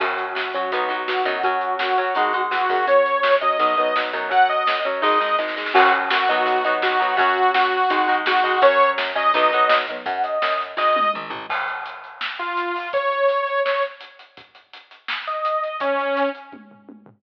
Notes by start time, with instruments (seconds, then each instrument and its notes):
0.00 electric bass (finger) F#2, overdriven guitar F#3 C#4, lead 2 (sawtooth) F#4, kick, crash
0.18 closed hi-hat
0.35 electric bass (finger) F#2, lead 2 (sawtooth) F#4, snare
0.54 overdriven guitar F#3 C#4, kick, closed hi-hat
0.71 electric bass (finger) B1, overdriven guitar F#3 B3 D#4, kick, closed hi-hat
0.89 overdriven guitar F#3 B3 D#4, closed hi-hat
1.07 electric bass (finger) B1, lead 2 (sawtooth) F#4, snare
1.25 electric bass (finger) F#2, overdriven guitar F#3 B3 D#4, kick, closed hi-hat
1.43 overdriven guitar F#3 C#4, lead 2 (sawtooth) F#4, kick, closed hi-hat
1.61 closed hi-hat
1.79 electric bass (finger) F#2, lead 2 (sawtooth) F#4, snare
1.97 overdriven guitar F#3 C#4, closed hi-hat
2.15 electric bass (finger) G#1, overdriven guitar G#3 D#4, kick, closed hi-hat
2.33 overdriven guitar G#3 D#4, closed hi-hat
2.51 electric bass (finger) E2, lead 2 (sawtooth) F#4, snare
2.69 electric bass (finger) F#2, overdriven guitar G#3 D#4, kick, open hi-hat
2.87 overdriven guitar F#3 C#4, lead 2 (sawtooth) C#5, kick, closed hi-hat
3.06 closed hi-hat
3.23 electric bass (finger) F#2, snare
3.41 overdriven guitar F#3 C#4, lead 2 (sawtooth) D#5, kick, closed hi-hat
3.59 electric bass (finger) B1, overdriven guitar F#3 B3 D#4, kick, closed hi-hat
3.77 overdriven guitar F#3 B3 D#4, closed hi-hat
3.96 electric bass (finger) B1, overdriven guitar F#3 B3 D#4, snare
4.13 electric bass (finger) F#2, overdriven guitar F#3 B3 D#4, kick, closed hi-hat
4.30 overdriven guitar F#3 C#4, lead 2 (sawtooth) F#5, kick, closed hi-hat
4.49 lead 2 (sawtooth) D#5, closed hi-hat
4.67 electric bass (finger) F#2, snare
4.85 overdriven guitar F#3 C#4, closed hi-hat
5.02 electric bass (finger) G#1, overdriven guitar G#3 D#4, lead 2 (sawtooth) D#5, kick, snare
5.20 overdriven guitar G#3 D#4, snare
5.38 electric bass (finger) G#1, overdriven guitar G#3 D#4, snare
5.48 snare
5.56 overdriven guitar G#3 D#4, snare
5.66 snare
5.74 electric bass (finger) F#2, overdriven guitar F#3 C#4, lead 2 (sawtooth) F#4, kick, crash
5.93 closed hi-hat
6.10 electric bass (finger) F#2, lead 2 (sawtooth) F#4, snare
6.28 overdriven guitar F#3 B3 D#4, kick, closed hi-hat
6.46 electric bass (finger) B1, kick, closed hi-hat
6.64 overdriven guitar F#3 B3 D#4, closed hi-hat
6.82 electric bass (finger) B1, lead 2 (sawtooth) F#4, snare
7.00 overdriven guitar F#3 B3 D#4, kick, closed hi-hat
7.17 electric bass (finger) F#2, overdriven guitar F#3 C#4, lead 2 (sawtooth) F#4, kick, closed hi-hat
7.36 closed hi-hat
7.54 electric bass (finger) F#2, lead 2 (sawtooth) F#4, snare
7.72 closed hi-hat
7.90 electric bass (finger) G#1, overdriven guitar G#3 D#4, kick, closed hi-hat
8.08 overdriven guitar G#3 D#4, closed hi-hat
8.26 electric bass (finger) G#1, lead 2 (sawtooth) F#4, snare
8.44 overdriven guitar G#3 D#4, kick, closed hi-hat
8.62 electric bass (finger) F#2, overdriven guitar F#3 C#4, lead 2 (sawtooth) C#5, kick, closed hi-hat
8.80 closed hi-hat
8.98 electric bass (finger) F#2, snare
9.15 overdriven guitar F#3 C#4, lead 2 (sawtooth) D#5, kick, closed hi-hat
9.34 electric bass (finger) B1, overdriven guitar F#3 B3 D#4, kick, closed hi-hat
9.53 overdriven guitar F#3 B3 D#4, closed hi-hat
9.69 electric bass (finger) B1, snare
9.88 overdriven guitar F#3 B3 D#4, kick, closed hi-hat
10.06 electric bass (finger) F#2, lead 2 (sawtooth) F#5, kick, closed hi-hat
10.24 lead 2 (sawtooth) D#5, closed hi-hat
10.42 electric bass (finger) F#2, snare
10.60 closed hi-hat
10.77 electric bass (finger) G#1, lead 2 (sawtooth) D#5, kick, snare
10.96 high tom
11.14 electric bass (finger) A#1, mid tom
11.30 electric bass (finger) A1, floor tom
11.50 kick, crash
11.68 closed hi-hat
11.86 closed hi-hat
12.04 closed hi-hat
12.21 snare
12.39 lead 2 (sawtooth) F4, closed hi-hat
12.57 closed hi-hat
12.76 open hi-hat
12.93 lead 2 (sawtooth) C#5, kick, closed hi-hat
13.12 closed hi-hat
13.29 closed hi-hat
13.47 closed hi-hat
13.65 lead 2 (sawtooth) C#5, snare
13.83 closed hi-hat
14.01 closed hi-hat
14.19 closed hi-hat
14.37 kick, closed hi-hat
14.55 closed hi-hat
14.73 closed hi-hat
14.91 closed hi-hat
15.08 snare
15.27 lead 2 (sawtooth) D#5, closed hi-hat
15.45 closed hi-hat
15.64 closed hi-hat
15.80 lead 2 (sawtooth) C#4, kick, closed hi-hat
15.99 closed hi-hat
16.17 closed hi-hat
16.35 closed hi-hat
16.52 kick, high tom
16.71 floor tom
16.89 high tom
17.06 floor tom